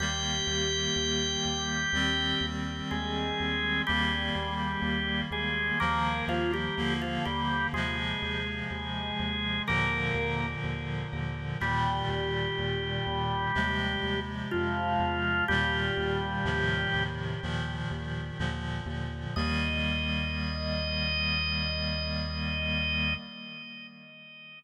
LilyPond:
<<
  \new Staff \with { instrumentName = "Drawbar Organ" } { \time 4/4 \key ees \major \tempo 4 = 62 <g' g''>2. <aes aes'>4 | <g g'>4. <aes aes'>8 <bes bes'>8 <f f'>16 <g g'>8 <f f'>16 <g g'>8 | <aes aes'>2 <bes bes'>4 r4 | <g g'>2. <f f'>4 |
<g g'>2 r2 | ees''1 | }
  \new Staff \with { instrumentName = "Clarinet" } { \time 4/4 \key ees \major <ees g bes>2 <ees g c'>2 | <ees g bes>2 <ees f bes>4 <d f bes>4 | <c f aes>2 <bes, d f>2 | <bes, ees g>2 <c f aes>2 |
<bes, ees g>4 <a, c ees f>4 <bes, ees f>4 <bes, d f>4 | <ees g bes>1 | }
  \new Staff \with { instrumentName = "Synth Bass 1" } { \clef bass \time 4/4 \key ees \major ees,8 ees,8 ees,8 ees,8 ees,8 ees,8 ees,8 ees,8 | ees,8 ees,8 ees,8 ees,8 ees,8 ees,8 ees,8 ees,8 | ees,8 ees,8 ees,8 ees,8 ees,8 ees,8 ees,8 ees,8 | ees,8 ees,8 ees,8 ees,8 ees,8 ees,8 f,8 e,8 |
ees,8 ees,8 ees,8 ees,8 ees,8 ees,8 ees,8 ees,8 | ees,1 | }
>>